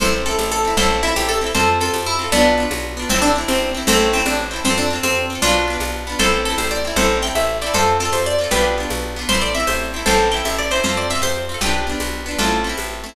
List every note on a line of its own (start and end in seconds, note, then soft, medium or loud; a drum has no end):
0.00 0.35 A1 medium
0.00 0.24 C4 loud
0.00 0.24 E4 loud
0.00 0.23 A4 medium
0.00 0.23 C5 medium
0.00 low conga medium
0.05 0.24 A4 loud
0.26 0.61 C4 medium
0.26 0.61 E4 medium
0.26 0.37 A4 medium
0.31 0.61 A4 medium
0.38 0.73 A1 medium
0.38 tambourine medium
0.38 high conga medium
0.52 0.76 A4 medium
0.65 0.77 C4 medium
0.65 0.77 E4 medium
0.70 0.77 A4 medium
0.77 1.12 A1 loud
0.77 1.01 C4 loud
0.77 1.01 E4 loud
0.77 1.01 A4 medium
0.77 1.01 C5 medium
0.77 low conga medium
0.83 1.01 A4 medium
1.03 1.38 C4 medium
1.03 1.14 E4 medium
1.03 1.38 E4 medium
1.08 1.38 A4 medium
1.16 1.51 A1 medium
1.16 1.28 G4 medium
1.16 tambourine medium
1.16 high conga medium
1.29 1.39 A4 medium
1.41 1.53 C4 medium
1.41 1.53 E4 medium
1.46 1.53 A4 medium
1.55 1.90 F2 medium
1.55 1.78 C4 medium
1.55 1.78 F4 loud
1.55 1.79 A4 medium
1.55 1.79 C5 medium
1.55 low conga medium
1.60 1.78 A4 loud
1.80 2.16 C4 medium
1.80 2.16 F4 medium
1.80 1.92 A4 medium
1.86 2.16 A4 medium
1.94 2.28 F2 medium
1.94 tambourine medium
1.94 high conga medium
2.06 2.30 E4 medium
2.19 2.31 C4 medium
2.19 2.31 F4 medium
2.24 2.31 A4 medium
2.32 2.67 B1 medium
2.32 2.64 B3 medium
2.32 2.56 B3 loud
2.32 2.64 D4 medium
2.32 2.56 D4 medium
2.32 low conga medium
2.37 2.56 F4 loud
2.58 2.93 B3 medium
2.58 2.93 D4 medium
2.63 2.93 F4 medium
2.71 3.06 B1 medium
2.71 tambourine medium
2.71 high conga medium
2.97 3.09 B3 medium
2.97 3.09 D4 medium
3.02 3.09 F4 medium
3.09 3.44 A1 medium
3.09 3.22 C4 medium
3.09 3.34 C4 loud
3.09 3.34 E4 loud
3.09 low conga medium
3.15 3.34 A4 loud
3.22 3.32 D4 medium
3.36 3.71 C4 medium
3.36 3.71 E4 medium
3.41 3.71 A4 medium
3.48 3.83 A1 medium
3.48 3.72 C4 medium
3.48 tambourine medium
3.48 high conga medium
3.74 3.86 C4 medium
3.74 3.86 E4 medium
3.80 3.86 A4 medium
3.87 4.22 A1 loud
3.87 4.12 A3 medium
3.87 4.11 C4 loud
3.87 4.12 C4 medium
3.87 4.11 E4 loud
3.87 low conga medium
3.92 4.11 A4 medium
4.13 4.48 C4 medium
4.13 4.25 C4 medium
4.13 4.48 E4 medium
4.18 4.48 A4 medium
4.25 4.60 A1 medium
4.25 4.37 D4 medium
4.25 tambourine medium
4.25 high conga medium
4.51 4.63 C4 medium
4.51 4.63 E4 medium
4.56 4.63 A4 medium
4.65 5.00 F2 medium
4.65 4.76 C4 medium
4.65 4.89 C4 medium
4.65 4.89 F4 loud
4.65 low conga medium
4.70 4.89 A4 loud
4.78 4.89 D4 medium
4.90 5.26 C4 medium
4.90 5.26 F4 medium
4.96 5.26 A4 medium
5.03 5.38 F2 medium
5.03 5.25 C4 medium
5.03 tambourine medium
5.03 high conga medium
5.30 5.42 C4 medium
5.30 5.42 F4 medium
5.35 5.42 A4 medium
5.42 5.77 B1 medium
5.42 5.66 B3 loud
5.42 5.76 D4 medium
5.42 5.66 D4 medium
5.42 5.76 F4 medium
5.42 low conga medium
5.47 5.66 F4 loud
5.68 6.03 B3 medium
5.68 6.03 D4 medium
5.73 6.03 F4 medium
5.80 6.15 B1 medium
5.80 tambourine medium
5.80 high conga medium
6.07 6.19 B3 medium
6.07 6.19 D4 medium
6.12 6.19 F4 medium
6.19 6.54 A1 medium
6.19 6.43 C4 loud
6.19 6.43 E4 loud
6.19 6.44 A4 medium
6.19 6.44 C5 medium
6.19 low conga medium
6.24 6.43 A4 loud
6.45 6.82 C4 medium
6.45 6.82 E4 medium
6.45 6.57 A4 medium
6.51 6.82 A4 medium
6.58 6.93 A1 medium
6.58 6.69 C5 medium
6.58 tambourine medium
6.58 high conga medium
6.71 6.94 D5 medium
6.85 6.96 C4 medium
6.85 6.97 E4 medium
6.90 6.97 A4 medium
6.96 7.31 A1 loud
6.96 7.21 C4 loud
6.96 7.21 E4 loud
6.96 7.18 A4 medium
6.96 7.18 C5 medium
6.96 low conga medium
7.02 7.21 A4 medium
7.22 7.58 C4 medium
7.22 7.58 E4 medium
7.22 7.35 G5 medium
7.27 7.58 A4 medium
7.35 7.70 A1 medium
7.35 7.57 E5 medium
7.35 tambourine medium
7.35 high conga medium
7.62 7.73 C4 medium
7.62 7.73 E4 medium
7.62 7.73 D5 medium
7.67 7.73 A4 medium
7.74 8.10 F2 medium
7.74 7.97 C4 medium
7.74 7.97 F4 loud
7.74 7.97 A4 medium
7.74 7.97 C5 medium
7.74 low conga medium
7.79 7.97 A4 loud
8.00 8.36 C4 medium
8.00 8.36 F4 medium
8.00 8.13 A4 medium
8.05 8.36 A4 medium
8.12 8.47 F2 medium
8.12 8.25 C5 medium
8.12 tambourine medium
8.12 high conga medium
8.26 8.51 D5 medium
8.39 8.50 C4 medium
8.39 8.50 F4 medium
8.44 8.50 A4 medium
8.51 8.86 B1 medium
8.51 8.75 B3 loud
8.51 8.75 D4 medium
8.51 8.74 G4 medium
8.51 8.74 B4 medium
8.51 low conga medium
8.56 8.75 F4 loud
8.78 9.13 B3 medium
8.78 9.13 D4 medium
8.83 9.13 F4 medium
8.90 9.25 B1 medium
8.90 tambourine medium
8.90 high conga medium
9.16 9.28 B3 medium
9.16 9.28 D4 medium
9.21 9.28 F4 medium
9.29 9.64 A1 medium
9.29 9.53 C4 loud
9.29 9.53 E4 loud
9.29 9.40 C5 medium
9.29 low conga medium
9.35 9.53 A4 loud
9.42 9.53 D5 medium
9.55 9.90 C4 medium
9.55 9.90 E4 medium
9.55 9.66 E5 medium
9.60 9.90 A4 medium
9.67 10.03 A1 medium
9.67 9.91 C5 medium
9.67 tambourine medium
9.67 high conga medium
9.94 10.05 C4 medium
9.94 10.06 E4 medium
9.99 10.06 A4 medium
10.06 10.42 A1 loud
10.06 10.30 C4 loud
10.06 10.30 E4 loud
10.06 10.30 A4 medium
10.06 10.30 C5 medium
10.06 low conga medium
10.11 10.30 A4 medium
10.31 10.67 C4 medium
10.31 10.67 E4 medium
10.31 10.43 G5 medium
10.37 10.67 A4 medium
10.45 10.80 A1 medium
10.45 10.56 E5 medium
10.45 tambourine medium
10.45 high conga medium
10.59 10.71 D5 medium
10.71 10.83 C4 medium
10.71 10.83 E4 medium
10.71 10.84 C5 medium
10.76 10.83 A4 medium
10.84 11.19 F2 medium
10.84 11.07 C4 medium
10.84 11.07 F4 loud
10.84 10.95 C5 medium
10.84 low conga medium
10.89 11.07 A4 loud
10.97 11.09 D5 medium
11.10 11.46 C4 medium
11.10 11.46 F4 medium
11.10 11.21 E5 medium
11.15 11.46 A4 medium
11.22 11.57 F2 medium
11.22 11.47 C5 medium
11.22 tambourine medium
11.22 high conga medium
11.49 11.61 C4 medium
11.49 11.61 F4 medium
11.54 11.61 A4 medium
11.61 11.96 B1 medium
11.61 11.85 B3 loud
11.61 11.85 D4 medium
11.61 11.86 G4 medium
11.61 11.86 B4 medium
11.61 low conga medium
11.66 11.85 F4 loud
11.87 12.22 B3 medium
11.87 12.22 D4 medium
11.92 12.22 F4 medium
12.00 12.35 B1 medium
12.00 tambourine medium
12.00 high conga medium
12.26 12.38 B3 medium
12.26 12.38 D4 medium
12.31 12.38 F4 medium
12.38 12.73 A1 loud
12.38 12.62 A3 medium
12.38 12.62 C4 medium
12.38 12.61 F4 medium
12.38 12.61 A4 medium
12.38 low conga medium
12.44 12.62 E4 medium
12.64 13.00 A3 medium
12.64 13.00 C4 medium
12.69 13.00 E4 medium
12.77 13.13 A1 medium
12.77 tambourine medium
12.77 high conga medium
13.04 13.15 A3 medium
13.04 13.15 C4 medium
13.09 13.15 E4 medium